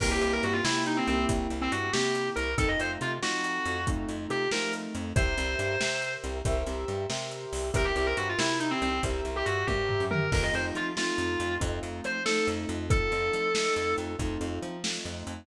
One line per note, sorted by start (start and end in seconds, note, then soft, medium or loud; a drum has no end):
0.00 0.18 C2 medium
0.00 0.60 A#3 loud
0.00 0.60 C4 loud
0.00 0.60 E4 medium
0.00 0.60 G4 medium
0.00 0.10 A#4 medium
0.00 kick medium
0.00 crash loud
0.11 0.21 G4 medium
0.21 0.40 C2 medium
0.21 0.32 G4 medium
0.21 closed hi-hat medium
0.33 0.43 A#4 medium
0.43 0.61 G2 medium
0.43 0.54 F#4 medium
0.43 closed hi-hat medium
0.53 0.63 F4 medium
0.64 1.01 C3 medium
0.64 1.06 A#3 medium
0.64 1.06 C4 medium
0.64 0.83 E4 medium
0.64 1.06 E4 medium
0.64 1.06 G4 medium
0.64 snare loud
0.86 0.97 D#4 medium
0.86 closed hi-hat medium
0.97 1.07 C4 medium
1.07 1.26 C2 medium
1.07 1.87 A#3 loud
1.07 1.25 C4 medium
1.07 1.87 C4 medium
1.07 1.87 E4 loud
1.07 1.87 G4 loud
1.07 closed hi-hat medium
1.29 1.47 C2 medium
1.29 kick medium
1.29 closed hi-hat medium
1.50 1.69 C2 medium
1.50 closed hi-hat medium
1.61 1.72 C4 medium
1.72 1.90 G2 medium
1.72 1.91 F#4 medium
1.72 closed hi-hat medium
1.93 2.30 C3 medium
1.93 2.53 A#3 medium
1.93 2.53 C4 medium
1.93 2.53 E4 medium
1.93 2.28 G4 medium
1.93 2.53 G4 medium
1.93 snare medium
2.15 closed hi-hat medium
2.36 2.55 C2 medium
2.36 2.54 A#4 medium
2.36 closed hi-hat medium
2.58 2.76 F2 medium
2.58 3.16 A3 medium
2.58 3.16 C4 medium
2.58 3.16 D#4 loud
2.58 3.16 F4 medium
2.58 2.68 A4 medium
2.58 kick medium
2.58 closed hi-hat medium
2.68 2.79 D#5 medium
2.79 2.98 F2 medium
2.79 2.91 C5 medium
2.79 closed hi-hat medium
3.01 3.19 C3 medium
3.01 3.12 F4 medium
3.01 closed hi-hat medium
3.22 3.59 F3 medium
3.22 3.80 A3 medium
3.22 3.80 C4 medium
3.22 3.80 D#4 medium
3.22 3.80 F4 medium
3.22 3.84 F#4 medium
3.22 snare medium
3.44 closed hi-hat medium
3.66 4.05 F2 medium
3.66 closed hi-hat medium
3.87 4.45 A3 loud
3.87 4.45 C4 medium
3.87 4.45 D#4 medium
3.87 4.45 F4 medium
3.87 kick medium
3.87 closed hi-hat medium
4.09 4.27 F2 medium
4.09 closed hi-hat medium
4.30 4.48 C3 medium
4.30 4.48 G4 medium
4.30 closed hi-hat medium
4.51 4.88 F3 medium
4.51 5.11 A3 medium
4.51 5.11 C4 medium
4.51 5.11 D#4 medium
4.51 5.11 F4 medium
4.51 4.73 A#4 medium
4.51 snare medium
4.73 closed hi-hat medium
4.95 5.13 F2 medium
4.95 closed hi-hat medium
5.16 5.34 C2 medium
5.16 5.75 G4 loud
5.16 5.75 A#4 medium
5.16 6.13 C5 medium
5.16 5.75 C5 loud
5.16 5.75 E5 loud
5.16 kick loud
5.16 closed hi-hat medium
5.38 5.56 C2 medium
5.38 closed hi-hat medium
5.59 5.77 G2 medium
5.59 closed hi-hat medium
5.80 6.17 C3 medium
5.80 6.38 G4 medium
5.80 6.38 A#4 medium
5.80 6.38 C5 medium
5.80 6.38 E5 medium
5.80 snare medium
6.02 closed hi-hat medium
6.24 6.42 C2 medium
6.24 closed hi-hat medium
6.45 6.64 C2 medium
6.45 7.04 G4 medium
6.45 7.04 A#4 medium
6.45 7.04 C5 loud
6.45 7.04 E5 loud
6.45 kick medium
6.45 closed hi-hat medium
6.67 6.85 C2 medium
6.67 closed hi-hat medium
6.88 7.06 G2 medium
6.88 closed hi-hat medium
7.10 7.46 C3 medium
7.10 7.68 G4 medium
7.10 7.68 A#4 medium
7.10 7.68 C5 medium
7.10 7.68 E5 medium
7.10 snare medium
7.31 closed hi-hat medium
7.53 7.71 C2 medium
7.53 open hi-hat medium
7.74 7.92 C2 medium
7.74 8.32 G4 loud
7.74 8.32 A#4 loud
7.74 7.85 A#4 medium
7.74 8.32 C5 medium
7.74 8.32 E5 loud
7.74 kick medium
7.74 closed hi-hat medium
7.85 7.95 G4 medium
7.96 8.14 C2 medium
7.96 8.06 G4 medium
7.96 closed hi-hat medium
8.06 8.17 A#4 medium
8.17 8.35 G2 medium
8.17 8.27 F#4 medium
8.17 closed hi-hat medium
8.29 8.39 F4 medium
8.38 8.75 C3 medium
8.38 8.57 E4 medium
8.38 8.96 G4 medium
8.38 8.96 A#4 medium
8.38 8.96 C5 medium
8.38 8.96 E5 medium
8.38 snare loud
8.60 8.70 D#4 medium
8.60 closed hi-hat medium
8.71 8.81 C4 medium
8.82 9.00 C2 medium
8.82 9.01 C4 medium
8.82 closed hi-hat medium
9.03 9.22 C2 medium
9.03 9.62 G4 medium
9.03 9.62 A#4 medium
9.03 9.62 C5 loud
9.03 9.62 E5 loud
9.03 kick medium
9.03 closed hi-hat medium
9.25 9.43 C2 medium
9.25 closed hi-hat medium
9.36 9.46 G4 medium
9.46 9.65 G2 medium
9.46 9.66 F#4 medium
9.46 closed hi-hat medium
9.67 9.97 G2 medium
9.67 10.03 G4 medium
9.67 10.26 G4 medium
9.67 10.26 A#4 medium
9.67 10.26 C5 medium
9.67 10.26 E5 medium
9.67 kick medium
9.67 high tom medium
9.89 floor tom medium
10.00 10.29 F#2 medium
10.11 10.30 A#4 medium
10.11 mid tom medium
10.32 10.50 F2 medium
10.32 10.90 A3 medium
10.32 10.90 C4 medium
10.32 10.90 D#4 loud
10.32 10.90 F4 medium
10.32 10.43 A#4 medium
10.32 kick medium
10.32 crash medium
10.43 10.53 D#5 medium
10.54 10.72 F2 medium
10.54 10.65 C5 medium
10.54 closed hi-hat medium
10.75 11.12 F3 medium
10.75 10.86 F4 medium
10.75 closed hi-hat medium
10.97 11.55 A3 medium
10.97 11.55 C4 medium
10.97 11.55 D#4 medium
10.97 11.54 F4 medium
10.97 11.55 F4 medium
10.97 snare medium
11.18 11.36 F2 medium
11.18 closed hi-hat medium
11.40 11.58 F2 medium
11.40 closed hi-hat medium
11.60 11.80 F2 loud
11.60 12.18 A3 medium
11.60 12.18 C4 loud
11.60 12.18 D#4 medium
11.60 12.18 F4 loud
11.60 kick medium
11.60 closed hi-hat medium
11.83 12.01 F2 medium
11.83 closed hi-hat medium
12.04 12.41 F3 medium
12.04 12.22 C5 medium
12.04 closed hi-hat medium
12.25 12.84 A3 medium
12.25 12.84 C4 medium
12.25 12.84 D#4 medium
12.25 12.84 F4 medium
12.25 12.46 A4 medium
12.25 snare medium
12.47 12.66 F2 medium
12.47 closed hi-hat medium
12.69 13.09 F2 medium
12.69 closed hi-hat medium
12.90 13.48 A3 medium
12.90 13.48 C4 medium
12.90 13.48 D#4 medium
12.90 13.48 F4 loud
12.90 13.94 A4 medium
12.90 kick loud
12.90 closed hi-hat medium
13.12 13.30 F2 medium
13.12 closed hi-hat medium
13.33 13.70 F3 medium
13.33 closed hi-hat medium
13.55 14.13 A3 medium
13.55 14.13 C4 medium
13.55 14.13 D#4 medium
13.55 14.13 F4 medium
13.55 snare medium
13.76 13.95 F2 medium
13.76 closed hi-hat medium
13.98 14.16 F2 medium
13.98 closed hi-hat medium
14.19 14.38 F2 medium
14.19 14.77 A3 medium
14.19 14.77 C4 medium
14.19 14.77 D#4 medium
14.19 14.77 F4 medium
14.19 kick medium
14.19 closed hi-hat medium
14.41 14.59 F2 medium
14.41 closed hi-hat medium
14.62 14.99 F3 medium
14.62 closed hi-hat medium
14.84 15.42 A3 medium
14.84 15.42 C4 medium
14.84 15.42 D#4 medium
14.84 15.42 F4 medium
14.84 snare medium
15.05 15.23 F2 medium
15.05 closed hi-hat medium
15.27 15.45 F2 medium
15.27 closed hi-hat medium